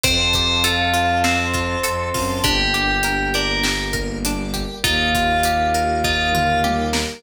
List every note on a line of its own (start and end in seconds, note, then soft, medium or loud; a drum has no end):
0.04 1.76 F2 loud
0.04 1.23 C4 loud
0.04 1.23 C5 medium
0.04 0.31 C5 medium
0.04 1.23 F5 medium
0.04 1.23 A5 loud
0.04 kick loud
0.04 closed hi-hat loud
0.33 2.35 G4 medium
0.33 0.63 C5 medium
0.33 kick medium
0.33 closed hi-hat medium
0.64 1.21 F4 medium
0.64 1.83 A4 medium
0.64 closed hi-hat loud
0.94 1.54 F4 medium
0.94 closed hi-hat medium
1.24 2.38 C4 medium
1.24 2.31 C4 medium
1.24 2.43 C5 medium
1.24 2.43 A5 medium
1.24 2.43 C6 loud
1.24 snare loud
1.54 2.14 F4 medium
1.54 kick medium
1.54 closed hi-hat medium
1.83 2.11 F2 medium
1.83 2.40 A4 medium
1.83 closed hi-hat loud
2.14 2.41 F#2 medium
2.14 2.43 F4 medium
2.14 kick medium
2.14 open hi-hat medium
2.44 4.65 G1 medium
2.44 3.63 A#3 medium
2.44 2.71 D4 loud
2.44 3.63 D4 loud
2.44 3.63 G4 medium
2.44 3.29 G4 medium
2.44 kick loud
2.44 closed hi-hat loud
2.74 3.01 G4 medium
2.74 closed hi-hat medium
3.03 3.31 A#4 medium
3.03 closed hi-hat loud
3.34 3.62 D4 medium
3.34 3.63 A#4 medium
3.34 closed hi-hat medium
3.63 4.83 G3 medium
3.63 4.83 A#3 medium
3.63 3.90 G4 medium
3.63 4.83 G4 medium
3.63 snare loud
3.93 4.20 A#4 medium
3.93 kick medium
3.93 closed hi-hat medium
4.25 4.53 D4 medium
4.25 closed hi-hat loud
4.54 4.81 G4 medium
4.54 kick medium
4.54 closed hi-hat medium
4.84 7.05 D#2 loud
4.84 6.03 A#3 medium
4.84 6.03 D#4 medium
4.84 5.11 D#4 medium
4.84 5.96 F4 medium
4.84 6.03 F4 medium
4.84 6.03 G4 medium
4.84 kick loud
4.84 closed hi-hat loud
5.15 5.42 F4 medium
5.15 kick medium
5.15 closed hi-hat medium
5.43 5.72 G4 medium
5.43 closed hi-hat loud
5.74 6.02 A#4 medium
5.74 closed hi-hat medium
6.04 7.23 A#3 medium
6.04 7.23 D#4 medium
6.04 6.32 D#4 medium
6.04 6.57 F4 medium
6.04 7.23 G4 medium
6.04 7.23 A#4 medium
6.04 kick medium
6.33 6.62 F4 medium
6.33 mid tom medium
6.64 6.91 G4 medium
6.64 high tom medium
6.93 7.20 A#4 medium
6.93 snare loud